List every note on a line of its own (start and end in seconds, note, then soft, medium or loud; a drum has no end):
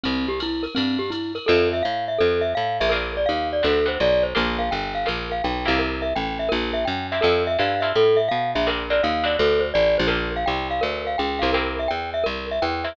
0.03 0.67 C2 medium
0.03 0.26 C4 medium
0.03 ride medium
0.28 0.39 G4 medium
0.40 0.65 E4 medium
0.40 hi-hat pedal medium
0.40 ride medium
0.63 0.74 A#4 medium
0.63 ride medium
0.75 1.39 G2 medium
0.75 0.97 C4 medium
0.75 ride medium
0.99 1.10 G4 medium
1.10 1.32 E4 medium
1.10 hi-hat pedal medium
1.10 ride medium
1.35 1.46 A#4 medium
1.35 ride medium
1.46 1.82 F2 loud
1.46 1.77 C4 medium
1.46 1.77 E4 medium
1.46 1.77 F4 medium
1.46 1.68 A4 medium
1.46 1.77 A4 medium
1.73 1.84 E5 medium
1.83 2.19 A2 medium
1.83 2.05 F5 medium
2.08 2.19 E5 medium
2.18 2.54 F2 medium
2.18 2.41 A4 medium
2.41 2.52 E5 medium
2.55 2.80 A2 medium
2.55 2.77 F5 medium
2.80 3.26 A#1 medium
2.80 2.91 E5 medium
2.89 3.20 C4 medium
2.89 3.20 D4 medium
2.89 3.20 F4 medium
2.89 3.11 A#4 medium
2.89 3.20 A#4 medium
3.17 3.28 D5 medium
3.26 3.62 D#2 medium
3.26 3.48 F5 medium
3.53 3.64 D5 medium
3.63 3.98 D2 medium
3.63 3.80 B3 medium
3.63 3.80 C4 medium
3.63 3.80 D4 medium
3.63 3.80 F#4 medium
3.63 3.86 A4 medium
3.86 4.07 B3 medium
3.86 4.07 C4 medium
3.86 4.07 D4 medium
3.86 4.07 F#4 medium
3.86 3.99 C5 medium
4.00 4.34 B1 medium
4.00 4.23 D5 medium
4.23 4.34 C5 medium
4.35 4.70 A#1 medium
4.35 4.63 A#3 medium
4.35 4.63 D4 medium
4.35 4.63 F4 medium
4.35 4.63 G4 medium
4.35 4.58 A#4 medium
4.59 4.70 F5 medium
4.71 5.06 G1 medium
4.71 4.93 G5 medium
4.95 5.06 F5 medium
5.06 5.42 A#1 medium
5.06 5.35 A#3 medium
5.06 5.35 D4 medium
5.06 5.35 F4 medium
5.06 5.35 G4 medium
5.06 5.29 A#4 medium
5.32 5.43 F5 medium
5.44 5.67 B1 medium
5.44 5.66 G5 medium
5.65 6.13 C2 medium
5.65 6.06 A#3 medium
5.65 6.06 C4 medium
5.65 6.06 E4 medium
5.65 6.06 G4 medium
5.65 5.78 F5 medium
5.79 6.01 A#4 medium
6.02 6.13 E5 medium
6.15 6.50 A1 medium
6.15 6.38 G5 medium
6.39 6.50 E5 medium
6.49 6.85 A#1 medium
6.49 6.71 A#4 medium
6.73 6.84 E5 medium
6.85 7.21 F#2 medium
6.85 7.07 G5 medium
7.12 7.20 A#3 medium
7.12 7.20 C4 medium
7.12 7.20 E4 medium
7.12 7.20 G4 medium
7.12 7.23 E5 medium
7.21 7.57 F2 medium
7.21 7.51 C4 medium
7.21 7.51 E4 medium
7.21 7.51 F4 medium
7.21 7.43 A4 medium
7.21 7.51 A4 medium
7.47 7.58 E5 medium
7.59 7.93 G2 medium
7.59 7.75 C4 medium
7.59 7.75 E4 medium
7.59 7.75 F4 medium
7.59 7.75 A4 medium
7.59 7.81 F5 medium
7.80 8.04 C4 medium
7.80 8.04 E4 medium
7.80 8.04 F4 medium
7.80 8.04 A4 medium
7.80 7.91 E5 medium
7.95 8.29 A2 medium
7.95 8.18 A4 medium
8.17 8.28 E5 medium
8.28 8.54 B2 medium
8.28 8.51 F5 medium
8.55 9.01 A#1 medium
8.55 8.66 E5 medium
8.67 8.84 C4 medium
8.67 8.84 D4 medium
8.67 8.84 F4 medium
8.67 8.84 A#4 medium
8.67 8.89 A#4 medium
8.90 9.12 C4 medium
8.90 9.12 D4 medium
8.90 9.12 F4 medium
8.90 9.12 A#4 medium
8.90 9.01 D5 medium
9.03 9.37 D#2 medium
9.03 9.25 F5 medium
9.24 9.64 B3 medium
9.24 9.64 C4 medium
9.24 9.64 D4 medium
9.24 9.64 F#4 medium
9.24 9.36 D5 medium
9.39 9.73 D2 medium
9.39 9.61 A4 medium
9.60 9.70 C5 medium
9.74 9.98 A1 medium
9.74 9.96 D5 medium
9.98 10.45 A#1 medium
9.98 10.09 C5 medium
10.07 10.36 A#3 medium
10.07 10.36 D4 medium
10.07 10.36 F4 medium
10.07 10.36 G4 medium
10.07 10.30 A#4 medium
10.36 10.47 F5 medium
10.46 10.81 C2 medium
10.46 10.68 G5 medium
10.71 10.82 F5 medium
10.81 11.16 D2 medium
10.81 11.03 A#4 medium
11.07 11.18 F5 medium
11.18 11.42 C#2 medium
11.18 11.40 G5 medium
11.39 11.88 C2 medium
11.39 11.50 A#3 medium
11.39 11.50 D4 medium
11.39 11.50 F4 medium
11.39 11.50 G4 medium
11.39 11.50 F5 medium
11.53 11.83 A#3 medium
11.53 11.83 C4 medium
11.53 11.83 E4 medium
11.53 11.83 G4 medium
11.53 11.75 A#4 medium
11.79 11.90 E5 medium
11.88 12.24 E2 medium
11.88 12.10 G5 medium
12.14 12.25 E5 medium
12.24 12.60 C2 medium
12.24 12.46 A#4 medium
12.51 12.62 E5 medium
12.62 12.96 E2 medium
12.62 12.84 G5 medium
12.84 12.93 A#3 medium
12.84 12.93 C4 medium
12.84 12.93 E4 medium
12.84 12.93 G4 medium
12.84 12.95 E5 medium